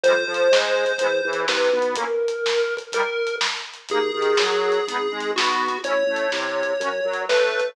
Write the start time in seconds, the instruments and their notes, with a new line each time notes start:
0.04 drawbar organ F2, accordion G3 G#3, lead 1 (square) C5, kick, closed hi-hat
0.09 accordion C4 F4
0.26 drawbar organ F2, accordion F3
0.34 closed hi-hat
0.52 drawbar organ G#2, accordion G#3, snare
0.85 kick, closed hi-hat
0.98 drawbar organ E2, accordion G#3 B3, kick, closed hi-hat
1.04 accordion E4
1.25 drawbar organ E2, accordion E3
1.33 closed hi-hat
1.48 drawbar organ C2, accordion C3, lead 1 (square) B4, snare
1.64 snare
1.73 drawbar organ B1, accordion B3
1.79 kick, closed hi-hat
1.96 accordion A#3 C#4, lead 1 (square) A#4, kick, closed hi-hat
2.01 accordion E4
2.28 closed hi-hat
2.46 snare
2.77 kick, closed hi-hat
2.92 accordion G3 A#3, lead 1 (square) A#4, kick, closed hi-hat
2.98 accordion D#4
3.27 closed hi-hat
3.41 snare
3.57 snare
3.74 closed hi-hat
3.89 drawbar organ D#2, accordion A#3 D#4, lead 1 (square) G#4, kick, closed hi-hat
3.95 accordion G#4
4.14 drawbar organ D#2, accordion D#3
4.22 closed hi-hat
4.37 drawbar organ F#2, accordion F#3, snare
4.72 closed hi-hat
4.88 drawbar organ G#1, accordion B3 D#4, kick, closed hi-hat
4.93 accordion G#4
5.11 drawbar organ G#1, accordion G#3
5.20 closed hi-hat
5.36 drawbar organ B1, accordion B3, lead 1 (square) F#4, snare
5.52 snare
5.69 kick, closed hi-hat
5.83 drawbar organ A1, accordion C#4 E4, lead 1 (square) C#5, kick, closed hi-hat
5.90 accordion A4
6.07 drawbar organ A1, accordion A3
6.16 closed hi-hat
6.32 drawbar organ C2, accordion C3, snare
6.63 kick, closed hi-hat
6.80 drawbar organ F#2, accordion C#4 F#4, kick, closed hi-hat
6.85 accordion A#4
7.05 drawbar organ F#2, accordion F#3
7.14 closed hi-hat
7.29 drawbar organ A2, accordion A3, lead 1 (square) B4, snare
7.46 snare
7.60 kick, closed hi-hat